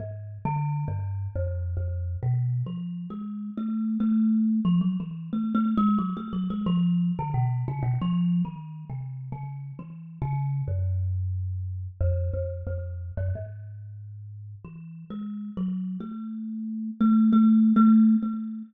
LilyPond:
\new Staff { \time 4/4 \tempo 4 = 90 \tuplet 3/2 { aes,4 d4 g,4 f,4 f,4 b,4 } | \tuplet 3/2 { f4 aes4 a4 } a4 f16 ges16 e8 | \tuplet 3/2 { a8 a8 aes8 } ges16 a16 ges16 aes16 f8. d16 b,8 des16 b,16 | \tuplet 3/2 { f4 ees4 c4 des4 e4 des4 } |
ges,2 f,8 f,8 f,8. ges,16 | aes,2 \tuplet 3/2 { e4 aes4 ges4 } | a4. a8 \tuplet 3/2 { a4 a4 a4 } | }